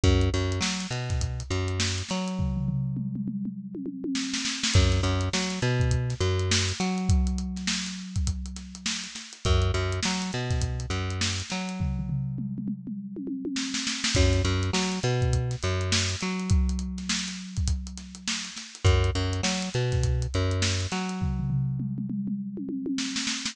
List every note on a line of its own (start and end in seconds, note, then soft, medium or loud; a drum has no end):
0.04 0.30 F#2 loud
0.04 kick loud
0.04 closed hi-hat medium
0.21 closed hi-hat medium
0.34 0.60 F#2 medium
0.34 closed hi-hat medium
0.52 closed hi-hat medium
0.61 0.87 F#3 medium
0.61 snare loud
0.81 closed hi-hat medium
0.91 1.43 B2 medium
0.91 closed hi-hat medium
1.09 kick medium
1.09 snare soft
1.09 closed hi-hat medium
1.21 kick medium
1.21 closed hi-hat loud
1.40 closed hi-hat medium
1.50 2.03 F#2 medium
1.50 closed hi-hat medium
1.68 closed hi-hat medium
1.80 snare loud
1.98 closed hi-hat medium
2.09 4.38 F#3 medium
2.09 snare medium
2.09 closed hi-hat medium
2.28 closed hi-hat medium
2.39 kick medium
2.39 floor tom medium
2.57 floor tom medium
2.68 floor tom medium
2.97 mid tom medium
3.16 mid tom medium
3.28 mid tom medium
3.45 mid tom medium
3.75 high tom medium
3.86 high tom medium
4.04 high tom medium
4.15 snare medium
4.34 snare medium
4.45 snare medium
4.63 snare loud
4.74 5.01 F#2 loud
4.74 kick loud
4.74 closed hi-hat loud
4.92 snare soft
4.92 closed hi-hat medium
5.03 5.29 F#2 medium
5.03 closed hi-hat medium
5.21 closed hi-hat medium
5.33 5.60 F#3 medium
5.33 snare loud
5.50 snare soft
5.50 closed hi-hat medium
5.62 6.14 B2 medium
5.62 closed hi-hat medium
5.80 kick medium
5.80 closed hi-hat medium
5.91 kick medium
5.91 closed hi-hat loud
6.10 snare soft
6.10 closed hi-hat medium
6.20 6.73 F#2 medium
6.20 closed hi-hat medium
6.39 closed hi-hat medium
6.51 snare loud
6.69 closed hi-hat medium
6.80 9.07 F#3 medium
6.80 snare medium
6.80 closed hi-hat medium
6.98 closed hi-hat medium
7.09 kick loud
7.09 closed hi-hat loud
7.27 closed hi-hat medium
7.38 closed hi-hat medium
7.56 snare soft
7.56 closed hi-hat medium
7.67 snare loud
7.87 snare soft
7.87 closed hi-hat medium
8.16 kick medium
8.16 closed hi-hat medium
8.27 kick medium
8.27 closed hi-hat loud
8.46 closed hi-hat medium
8.56 snare soft
8.56 closed hi-hat medium
8.75 closed hi-hat medium
8.86 snare loud
9.04 closed hi-hat medium
9.15 snare medium
9.15 closed hi-hat medium
9.33 closed hi-hat medium
9.45 9.72 F#2 loud
9.45 kick loud
9.45 closed hi-hat medium
9.62 closed hi-hat medium
9.74 10.00 F#2 medium
9.74 closed hi-hat medium
9.93 closed hi-hat medium
10.03 10.31 F#3 medium
10.03 snare loud
10.22 closed hi-hat medium
10.33 10.86 B2 medium
10.33 closed hi-hat medium
10.51 kick medium
10.51 snare soft
10.51 closed hi-hat medium
10.62 kick medium
10.62 closed hi-hat loud
10.80 closed hi-hat medium
10.90 11.42 F#2 medium
10.90 closed hi-hat medium
11.10 closed hi-hat medium
11.21 snare loud
11.40 closed hi-hat medium
11.50 13.79 F#3 medium
11.50 snare medium
11.50 closed hi-hat medium
11.69 closed hi-hat medium
11.80 kick medium
11.80 floor tom medium
11.99 floor tom medium
12.09 floor tom medium
12.38 mid tom medium
12.58 mid tom medium
12.68 mid tom medium
12.87 mid tom medium
13.16 high tom medium
13.27 high tom medium
13.45 high tom medium
13.56 snare medium
13.74 snare medium
13.87 snare medium
14.04 snare loud
14.15 14.42 F#2 loud
14.15 kick loud
14.15 closed hi-hat loud
14.33 snare soft
14.33 closed hi-hat medium
14.45 14.71 F#2 medium
14.45 closed hi-hat medium
14.63 closed hi-hat medium
14.73 14.99 F#3 medium
14.73 snare loud
14.92 snare soft
14.92 closed hi-hat medium
15.03 15.56 B2 medium
15.03 closed hi-hat medium
15.22 kick medium
15.22 closed hi-hat medium
15.33 kick medium
15.33 closed hi-hat loud
15.51 snare soft
15.51 closed hi-hat medium
15.63 16.16 F#2 medium
15.63 closed hi-hat medium
15.81 closed hi-hat medium
15.92 snare loud
16.10 closed hi-hat medium
16.21 18.50 F#3 medium
16.21 snare medium
16.21 closed hi-hat medium
16.40 closed hi-hat medium
16.50 kick loud
16.50 closed hi-hat loud
16.69 closed hi-hat medium
16.79 closed hi-hat medium
16.98 snare soft
16.98 closed hi-hat medium
17.09 snare loud
17.27 snare soft
17.27 closed hi-hat medium
17.57 kick medium
17.57 closed hi-hat medium
17.68 kick medium
17.68 closed hi-hat loud
17.87 closed hi-hat medium
17.98 snare soft
17.98 closed hi-hat medium
18.15 closed hi-hat medium
18.28 snare loud
18.45 closed hi-hat medium
18.56 snare medium
18.56 closed hi-hat medium
18.75 closed hi-hat medium
18.85 19.11 F#2 loud
18.85 kick loud
18.85 closed hi-hat medium
19.04 closed hi-hat medium
19.15 19.41 F#2 medium
19.15 closed hi-hat medium
19.33 closed hi-hat medium
19.43 19.69 F#3 medium
19.43 snare loud
19.62 closed hi-hat medium
19.74 20.27 B2 medium
19.74 closed hi-hat medium
19.92 kick medium
19.92 snare soft
19.92 closed hi-hat medium
20.04 kick medium
20.04 closed hi-hat loud
20.22 closed hi-hat medium
20.34 20.87 F#2 medium
20.34 closed hi-hat medium
20.51 closed hi-hat medium
20.62 snare loud
20.81 closed hi-hat medium
20.92 23.19 F#3 medium
20.92 snare medium
20.92 closed hi-hat medium
21.09 closed hi-hat medium
21.21 kick medium
21.21 floor tom medium
21.39 floor tom medium
21.50 floor tom medium
21.80 mid tom medium
21.98 mid tom medium
22.10 mid tom medium
22.28 mid tom medium
22.57 high tom medium
22.69 high tom medium
22.86 high tom medium
22.98 snare medium
23.16 snare medium
23.27 snare medium
23.46 snare loud